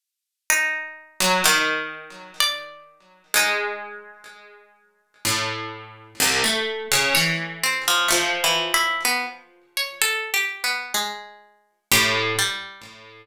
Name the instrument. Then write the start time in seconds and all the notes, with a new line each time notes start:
harpsichord
0.50 D#4
1.20 F#3
1.44 D#3
2.40 D5
3.34 G#3 D#4
5.25 A2
6.20 C2
6.44 A3
6.92 C#3
7.15 E3 C#5
7.63 C4
7.88 F3
8.08 F3 A3
8.44 E3
8.74 E4
9.05 B3
9.77 C#5
10.02 A4
10.34 G4
10.64 B3
10.94 G#3
11.91 A2 G4
12.38 G3